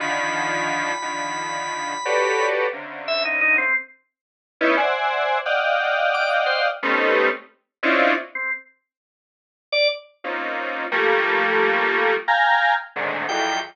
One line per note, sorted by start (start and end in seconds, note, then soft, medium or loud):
0.00 0.92 D3 loud
0.00 0.92 D#3 loud
0.00 0.92 F3 loud
0.00 2.46 B5 medium
1.02 1.94 D3 medium
1.02 1.94 D#3 medium
1.02 1.94 F3 medium
2.05 2.67 F#4 medium
2.05 2.67 G4 medium
2.05 2.67 A4 medium
2.05 2.67 B4 medium
2.05 2.67 C#5 medium
2.05 2.67 D5 medium
2.73 3.65 C3 medium
2.73 3.65 C#3 medium
2.73 3.65 D3 medium
3.08 3.23 E5 loud
3.25 3.40 D#4 medium
3.41 3.57 D#4 loud
3.58 3.73 C4 medium
4.61 4.76 B3 loud
4.61 4.76 C#4 loud
4.61 4.76 D#4 loud
4.61 4.76 E4 loud
4.77 5.38 C5 medium
4.77 5.38 D5 medium
4.77 5.38 E5 medium
4.77 5.38 F#5 medium
4.77 5.38 G#5 medium
5.45 6.68 D5 medium
5.45 6.68 D#5 medium
5.45 6.68 F5 medium
5.45 6.68 F#5 medium
5.45 6.68 G5 medium
6.14 6.30 D6 medium
6.46 6.61 C5 medium
6.83 7.29 G3 loud
6.83 7.29 A3 loud
6.83 7.29 B3 loud
6.83 7.29 C4 loud
6.83 7.29 C#4 loud
6.83 7.29 D#4 loud
7.83 8.13 C4 loud
7.83 8.13 C#4 loud
7.83 8.13 D4 loud
7.83 8.13 D#4 loud
7.83 8.13 E4 loud
7.83 8.13 F4 loud
8.35 8.50 C4 medium
9.72 9.88 D5 loud
10.24 10.85 A#3 medium
10.24 10.85 C4 medium
10.24 10.85 C#4 medium
10.24 10.85 D#4 medium
10.24 10.85 F4 medium
10.92 12.14 F3 loud
10.92 12.14 G3 loud
10.92 12.14 A3 loud
10.92 12.14 A#3 loud
12.28 12.74 F5 medium
12.28 12.74 G5 medium
12.28 12.74 G#5 medium
12.28 12.74 A#5 medium
12.96 13.26 G#2 medium
12.96 13.26 A2 medium
12.96 13.26 A#2 medium
12.96 13.26 C3 medium
12.96 13.26 D3 medium
12.96 13.26 D#3 medium
13.29 13.60 E2 loud
13.29 13.60 F2 loud
13.29 13.60 F#2 loud
13.29 13.59 G5 medium